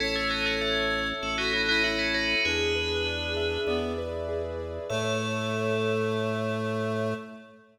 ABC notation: X:1
M:4/4
L:1/16
Q:1/4=98
K:Alyd
V:1 name="Tubular Bells"
[CE] [A,C] [B,D] [A,C] [A,C]4 [FA] [B,D] [B,D] [B,D] [DF] [CE] [DF]2 | [GB]10 z6 | A16 |]
V:2 name="Clarinet"
c8 A F E E E4 | =D8 B,2 z6 | A,16 |]
V:3 name="Acoustic Grand Piano"
A2 c2 e2 c2 A2 c2 e2 c2 | G2 B2 =d2 e2 d2 B2 G2 B2 | [Ace]16 |]
V:4 name="Drawbar Organ" clef=bass
A,,,8 A,,,8 | E,,8 E,,8 | A,,16 |]